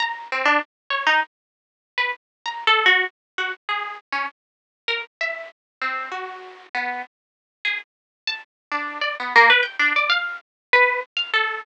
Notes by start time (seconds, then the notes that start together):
0.00 A#5
0.32 C4
0.45 D4
0.90 C#5
1.07 D#4
1.98 B4
2.46 A#5
2.67 A4
2.86 F#4
3.38 F#4
3.69 G#4
4.13 C#4
4.88 A#4
5.21 E5
5.82 C4
6.12 F#4
6.75 B3
7.65 G#4
8.27 A5
8.72 D4
9.01 D5
9.20 B3
9.36 A#3
9.50 B4
9.63 G5
9.79 D4
9.96 D5
10.10 F5
10.73 B4
11.17 F5
11.34 A4